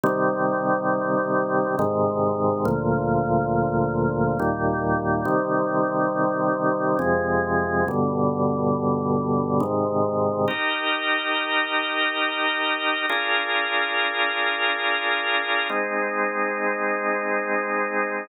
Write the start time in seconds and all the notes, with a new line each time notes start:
0.03 C3 D#3 G3
1.79 G#2 C3 D#3
2.65 D2 A#2 F3
4.39 D#2 A#2 G3
5.25 C3 D#3 G3
6.99 F2 C3 G#3
7.88 G2 B2 D3
9.60 G#2 C3 D#3
10.48 D#4 G4 A#4
13.09 D4 F4 G#4 A#4
15.69 G#3 C4 D#4